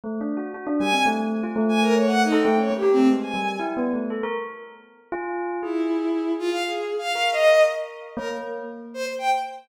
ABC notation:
X:1
M:6/4
L:1/16
Q:1/4=118
K:none
V:1 name="Violin"
z4 | z2 _a2 z5 a _B _d (3_g2 _E2 =g2 (3d2 G2 C2 z a3 | z16 E6 F f | (3_A4 f4 _e4 z4 _B z5 c z g z3 |]
V:2 name="Tubular Bells"
(3A,2 D2 _G2 | _G D =G, C A,3 F A,6 A A, _D _B, =G A, _A,2 G,2 | (3E2 B,2 A,2 A _B z6 F4 _A8 | z4 _B8 _B,4 z8 |]